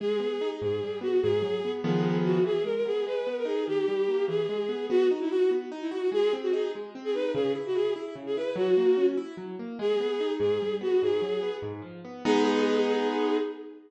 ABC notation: X:1
M:6/8
L:1/16
Q:3/8=98
K:G#m
V:1 name="Violin"
G6 G4 F2 | G6 G4 F2 | G2 A A G2 B3 A G2 | =G6 ^G6 |
[K:B] F2 z E F2 z3 E F2 | G2 z F G2 z3 G B2 | G2 z F G2 z3 G B2 | F6 z6 |
[K:G#m] G6 G4 F2 | G6 z6 | G12 |]
V:2 name="Acoustic Grand Piano"
G,2 B,2 D2 G,,2 =G,2 B,2 | G,,2 F,2 B,2 [D,^E,G,B,]6 | E,2 G,2 B,2 G,2 B,2 D2 | D,2 =G,2 A,2 E,2 ^G,2 B,2 |
[K:B] B,2 D2 F2 B,2 D2 F2 | G,2 ^B,2 D2 G,2 B,2 D2 | C,2 E2 E2 E2 C,2 E2 | F,2 A,2 C2 E2 F,2 A,2 |
[K:G#m] G,2 B,2 D2 G,,2 =G,2 B,2 | G,,2 F,2 B,2 G,,2 ^E,2 B,2 | [G,B,D]12 |]